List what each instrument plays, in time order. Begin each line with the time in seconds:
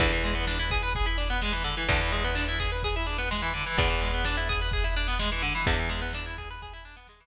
0.00 electric bass (finger) E2, overdriven guitar D3, kick, closed hi-hat
0.12 overdriven guitar E3
0.23 overdriven guitar G#3, closed hi-hat
0.35 overdriven guitar B3
0.47 overdriven guitar D4, snare
0.59 overdriven guitar E4
0.70 overdriven guitar G#4, kick, closed hi-hat
0.83 overdriven guitar B4
0.95 overdriven guitar G#4, kick, closed hi-hat
1.06 overdriven guitar E4
1.18 overdriven guitar D4, closed hi-hat
1.30 overdriven guitar B3
1.42 overdriven guitar G#3, snare
1.52 overdriven guitar E3
1.64 overdriven guitar D3, closed hi-hat
1.77 overdriven guitar E3
1.89 electric bass (finger) E2, overdriven guitar D3, kick, closed hi-hat
2.01 overdriven guitar E3
2.12 overdriven guitar G#3, closed hi-hat
2.24 overdriven guitar B3
2.35 overdriven guitar D4, snare
2.48 overdriven guitar E4
2.60 overdriven guitar G#4, kick, closed hi-hat
2.72 overdriven guitar B4
2.83 overdriven guitar G#4, kick, closed hi-hat
2.96 overdriven guitar E4
3.06 overdriven guitar D4, closed hi-hat
3.18 overdriven guitar B3
3.31 overdriven guitar G#3, snare
3.42 overdriven guitar E3
3.54 overdriven guitar D3, closed hi-hat
3.66 overdriven guitar E3
3.78 electric bass (finger) E2, overdriven guitar D3, kick, closed hi-hat
3.90 overdriven guitar E3
4.01 overdriven guitar G#3, closed hi-hat
4.14 overdriven guitar B3
4.24 overdriven guitar D4, snare
4.37 overdriven guitar E4
4.49 overdriven guitar G#4, kick, closed hi-hat
4.61 overdriven guitar B4
4.72 overdriven guitar G#4, kick, closed hi-hat
4.84 overdriven guitar E4
4.96 overdriven guitar D4, closed hi-hat
5.08 overdriven guitar B3
5.19 overdriven guitar G#3, snare
5.32 overdriven guitar E3
5.42 overdriven guitar D3, closed hi-hat
5.55 overdriven guitar E3
5.66 electric bass (finger) E2, overdriven guitar D3, kick, closed hi-hat
5.79 overdriven guitar E3
5.89 overdriven guitar G#3, closed hi-hat
6.02 overdriven guitar B3
6.13 overdriven guitar D4, snare
6.26 overdriven guitar E4
6.38 overdriven guitar G#4, kick, closed hi-hat
6.50 overdriven guitar B4
6.61 overdriven guitar G#4, kick, closed hi-hat
6.73 overdriven guitar E4
6.85 overdriven guitar D4, closed hi-hat
6.97 overdriven guitar B3
7.07 overdriven guitar G#3, snare
7.20 overdriven guitar E3